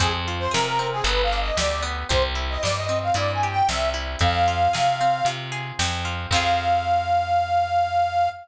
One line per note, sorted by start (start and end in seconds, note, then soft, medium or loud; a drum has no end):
0.00 0.48 F2 loud
0.00 0.79 C4 medium
0.00 0.13 G#4 loud
0.00 kick loud
0.00 closed hi-hat loud
0.28 1.03 F4 medium
0.39 0.52 C5 medium
0.51 1.01 C3 loud
0.51 1.01 G#4 medium
0.51 0.65 A#4 loud
0.51 snare loud
0.66 0.88 A#4 loud
0.79 1.04 C4 medium
0.92 1.05 G#4 medium
1.04 1.51 G1 loud
1.04 1.82 B3 medium
1.04 1.22 B4 medium
1.04 closed hi-hat loud
1.23 1.39 F5 medium
1.33 2.08 D4 medium
1.40 1.57 D#5 medium
1.57 2.04 D2 medium
1.57 2.07 G4 medium
1.57 1.83 D5 medium
1.57 snare loud
1.82 2.07 B3 medium
2.09 2.58 C2 loud
2.09 2.88 C4 medium
2.09 2.23 C5 medium
2.09 kick loud
2.09 closed hi-hat loud
2.35 3.15 E4 medium
2.50 2.62 D#5 medium
2.63 3.11 G2 medium
2.63 3.43 G4 medium
2.63 2.76 D5 loud
2.63 snare loud
2.76 2.99 D#5 medium
2.89 3.68 C4 medium
3.03 3.15 F5 medium
3.14 3.62 G2 medium
3.14 3.93 E4 medium
3.14 3.32 D5 medium
3.14 closed hi-hat loud
3.33 3.50 G#5 medium
3.43 4.18 G4 medium
3.51 3.68 G5 loud
3.68 4.16 C2 medium
3.68 4.19 C4 medium
3.68 3.90 E5 medium
3.68 snare loud
3.94 4.19 E4 medium
4.19 4.68 F2 loud
4.19 5.00 C4 medium
4.19 5.27 F5 loud
4.19 kick loud
4.19 closed hi-hat medium
4.48 5.26 F4 medium
4.73 5.22 C3 medium
4.73 5.51 G#4 medium
4.73 snare loud
5.01 5.79 C4 medium
5.25 5.72 C3 loud
5.25 6.04 F4 medium
5.25 closed hi-hat loud
5.52 6.27 G#4 medium
5.79 6.26 F2 loud
5.79 6.29 C4 medium
5.79 snare loud
6.05 6.30 F4 medium
6.31 8.28 F2 medium
6.31 8.30 C4 loud
6.31 8.30 F4 loud
6.31 8.29 F5 loud
6.31 kick loud
6.31 crash loud
6.36 8.30 G#4 medium